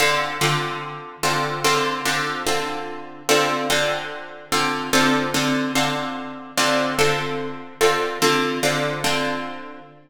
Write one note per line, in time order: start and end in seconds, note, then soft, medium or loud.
0.00 0.38 D3 loud
0.00 0.38 C4 medium
0.00 0.38 F4 loud
0.00 0.38 A4 loud
0.41 1.17 D3 loud
0.41 1.17 C4 medium
0.41 1.17 F4 medium
0.41 1.17 A4 medium
1.23 1.61 D3 medium
1.23 1.61 C4 medium
1.23 1.61 F4 medium
1.23 1.61 A4 medium
1.64 2.02 D3 loud
1.64 2.02 C4 loud
1.64 2.02 F4 loud
1.64 2.02 A4 loud
2.05 2.43 D3 loud
2.05 2.43 C4 medium
2.05 2.43 F4 medium
2.05 2.43 A4 medium
2.47 3.22 D3 medium
2.47 3.22 C4 medium
2.47 3.22 F4 loud
2.47 3.22 A4 medium
3.29 3.67 D3 loud
3.29 3.67 C4 loud
3.29 3.67 F4 loud
3.29 3.67 A4 loud
3.70 4.46 D3 loud
3.70 4.46 C4 loud
3.70 4.46 F4 medium
3.70 4.46 A4 medium
4.52 4.90 D3 loud
4.52 4.90 C4 medium
4.52 4.90 F4 medium
4.52 4.90 A4 medium
4.93 5.31 D3 loud
4.93 5.31 C4 loud
4.93 5.31 F4 loud
4.93 5.31 A4 loud
5.34 5.72 D3 medium
5.34 5.72 C4 medium
5.34 5.72 F4 medium
5.34 5.72 A4 medium
5.75 6.51 D3 medium
5.75 6.51 C4 medium
5.75 6.51 F4 loud
5.75 6.51 A4 medium
6.58 6.95 D3 loud
6.58 6.95 C4 loud
6.58 6.95 F4 loud
6.58 6.95 A4 loud
6.99 7.74 D3 medium
6.99 7.74 C4 medium
6.99 7.74 F4 medium
6.99 7.74 A4 loud
7.81 8.19 D3 medium
7.81 8.19 C4 loud
7.81 8.19 F4 loud
7.81 8.19 A4 medium
8.22 8.60 D3 loud
8.22 8.60 C4 loud
8.22 8.60 F4 loud
8.22 8.60 A4 loud
8.63 9.01 D3 loud
8.63 9.01 C4 medium
8.63 9.01 F4 medium
8.63 9.01 A4 medium
9.04 9.80 D3 loud
9.04 9.80 C4 medium
9.04 9.80 F4 medium
9.04 9.80 A4 medium